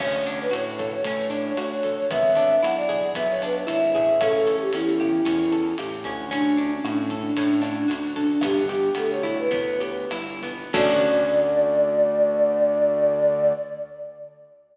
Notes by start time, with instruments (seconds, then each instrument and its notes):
0.00 synth bass 1 D2, acoustic guitar (steel) C#4, flute C#5, kick, cross-stick, crash
0.26 acoustic guitar (steel) D4, flute C#5, closed hi-hat
0.41 flute B4
0.51 synth bass 1 A2, acoustic guitar (steel) F#4, flute C#5, closed hi-hat
0.79 acoustic guitar (steel) A4, kick, cross-stick, closed hi-hat
0.93 flute C#5
1.04 synth bass 1 A2, acoustic guitar (steel) C#4, kick, closed hi-hat
1.30 acoustic guitar (steel) D4, closed hi-hat
1.45 flute C#5
1.57 synth bass 1 D2, acoustic guitar (steel) F#4, flute C#5, cross-stick, closed hi-hat
1.70 flute C#5
1.83 acoustic guitar (steel) A4, kick, closed hi-hat
1.97 flute C#5
2.10 synth bass 1 G#1, acoustic guitar (steel) B3, flute E5, kick, closed hi-hat
2.35 acoustic guitar (steel) D4, closed hi-hat
2.63 synth bass 1 B1, acoustic guitar (steel) E4, flute F#5, cross-stick, closed hi-hat
2.76 flute D5
2.89 acoustic guitar (steel) G#4, kick, closed hi-hat
3.15 synth bass 1 B1, acoustic guitar (steel) B3, flute E5, kick, closed hi-hat
3.29 flute C#5
3.41 acoustic guitar (steel) D4, flute B4, cross-stick, closed hi-hat
3.67 synth bass 1 G#1, acoustic guitar (steel) E4, flute E5, closed hi-hat
3.93 synth bass 1 A1, acoustic guitar (steel) G#4, flute E5, kick, closed hi-hat
4.21 acoustic guitar (steel) C#4, flute A4, kick, cross-stick, closed hi-hat
4.33 flute A4
4.46 acoustic guitar (steel) A4, closed hi-hat
4.59 flute G4
4.73 synth bass 1 E2, acoustic guitar (steel) C#4, flute E4, closed hi-hat
5.00 acoustic guitar (steel) G4, kick, cross-stick, closed hi-hat
5.25 synth bass 1 E2, acoustic guitar (steel) C#4, kick, closed hi-hat
5.52 acoustic guitar (steel) A4, closed hi-hat
5.78 synth bass 1 A1, acoustic guitar (steel) G4, cross-stick, closed hi-hat
6.04 synth bass 1 D2, acoustic guitar (steel) C#4, kick, closed hi-hat
6.31 acoustic guitar (steel) C#4, flute D4, kick, closed hi-hat
6.57 acoustic guitar (steel) D4, flute D4, closed hi-hat
6.71 flute C#4
6.84 synth bass 1 A2, flute D4, acoustic guitar (steel) F#4, cross-stick, closed hi-hat
7.10 acoustic guitar (steel) A4, kick, closed hi-hat
7.23 flute D4
7.37 synth bass 1 A2, acoustic guitar (steel) C#4, kick, closed hi-hat
7.62 acoustic guitar (steel) D4, cross-stick, closed hi-hat
7.77 flute D4
7.88 synth bass 1 D2, flute D4, acoustic guitar (steel) F#4, closed hi-hat
8.03 flute D4
8.16 acoustic guitar (steel) A4, kick, closed hi-hat
8.30 flute D4
8.41 synth bass 1 G1, acoustic guitar (steel) B3, flute G4, kick, cross-stick, closed hi-hat
8.68 flute G4, acoustic guitar (steel) G4, closed hi-hat
8.95 synth bass 1 D2, acoustic guitar (steel) B3, flute A4, closed hi-hat
9.10 flute C#5
9.23 acoustic guitar (steel) E4, kick, cross-stick, closed hi-hat
9.39 flute B4
9.51 synth bass 1 D2, acoustic guitar (steel) B3, kick, closed hi-hat
9.80 acoustic guitar (steel) G4, closed hi-hat
10.11 synth bass 1 G1, acoustic guitar (steel) E4, cross-stick, closed hi-hat
10.42 acoustic guitar (steel) B3, kick, closed hi-hat
10.73 synth bass 1 D2, acoustic guitar (steel) C#4 D4 F#4 A4, flute D5, kick, crash